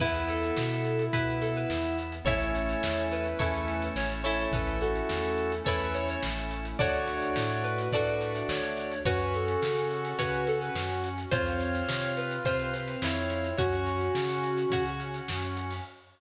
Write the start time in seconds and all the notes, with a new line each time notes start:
0.00 E2 B3 E4 B4, kick, crash
0.14 closed hi-hat
0.28 A4, closed hi-hat
0.43 closed hi-hat
0.56 B2, snare
0.71 closed hi-hat
0.85 closed hi-hat
0.99 closed hi-hat
1.13 B2 B3 E4 B4, kick, closed hi-hat
1.27 closed hi-hat
1.41 A4, closed hi-hat
1.56 B4, closed hi-hat
1.70 E2, snare
1.84 closed hi-hat
1.98 closed hi-hat
2.12 closed hi-hat
2.25 A1 A3 C#4 E4 A4 C#5, kick, closed hi-hat
2.41 closed hi-hat
2.55 closed hi-hat
2.69 closed hi-hat
2.83 E2, snare
2.97 closed hi-hat
3.10 E4 B4, closed hi-hat
3.25 closed hi-hat
3.39 E2 A3 C#4 E4 A4 C#5, kick, closed hi-hat
3.54 closed hi-hat
3.68 closed hi-hat
3.82 closed hi-hat
3.96 A1 C#5, snare
4.10 closed hi-hat
4.24 A3 C#4 E4 A4 C#5, closed hi-hat
4.39 closed hi-hat
4.52 A1 A3 C#4 E4 A4 B4, kick, closed hi-hat
4.67 closed hi-hat
4.80 F#4 A4, closed hi-hat
4.95 closed hi-hat
5.09 E2, snare
5.24 closed hi-hat
5.38 closed hi-hat
5.52 closed hi-hat
5.64 E2 A3 C#4 E4 A4 B4 C#5, kick, closed hi-hat
5.80 closed hi-hat
5.94 C#5, closed hi-hat
6.08 C#5, closed hi-hat
6.23 A1, snare
6.37 closed hi-hat
6.51 closed hi-hat
6.65 closed hi-hat
6.79 D2 A3 D4 F#4 A4 C#5 D5, kick, closed hi-hat
6.93 closed hi-hat
7.08 closed hi-hat
7.22 closed hi-hat
7.36 A2, snare
7.50 closed hi-hat
7.63 B4, closed hi-hat
7.78 closed hi-hat
7.92 A2 A3 D4 F#4 A4 D5, kick, closed hi-hat
8.07 closed hi-hat
8.21 closed hi-hat
8.35 closed hi-hat
8.49 D2 C#5, snare
8.63 closed hi-hat
8.77 closed hi-hat
8.92 closed hi-hat
9.05 F#2 C#4 F#4 B4 C#5, kick, closed hi-hat
9.20 closed hi-hat
9.34 A4, closed hi-hat
9.48 closed hi-hat
9.62 C#3, snare
9.76 closed hi-hat
9.91 closed hi-hat
10.05 closed hi-hat
10.17 C#3 C#4 F#4 B4 C#5, kick, closed hi-hat
10.33 closed hi-hat
10.47 A4, closed hi-hat
10.61 B4, closed hi-hat
10.75 F#2, snare
10.90 closed hi-hat
11.04 closed hi-hat
11.18 closed hi-hat
11.31 F2 C4 F4 C5 C#5, kick, closed hi-hat
11.46 closed hi-hat
11.60 closed hi-hat
11.75 closed hi-hat
11.88 C3, snare
12.03 closed hi-hat
12.17 B4, closed hi-hat
12.31 closed hi-hat
12.45 C3 C4 F4 C5, kick, closed hi-hat
12.59 closed hi-hat
12.74 closed hi-hat
12.88 closed hi-hat
13.02 F2 E4 C#5, snare
13.16 closed hi-hat
13.30 closed hi-hat
13.44 closed hi-hat
13.57 F#2 C#4 F#4 C#5, kick, closed hi-hat
13.73 closed hi-hat
13.87 closed hi-hat
14.01 closed hi-hat
14.15 C#3, snare
14.29 closed hi-hat
14.44 closed hi-hat
14.58 closed hi-hat
14.70 C#3 C#4 F#4 C#5, kick, closed hi-hat
14.86 closed hi-hat
15.00 closed hi-hat
15.14 closed hi-hat
15.28 F#2, snare
15.42 closed hi-hat
15.57 closed hi-hat
15.71 open hi-hat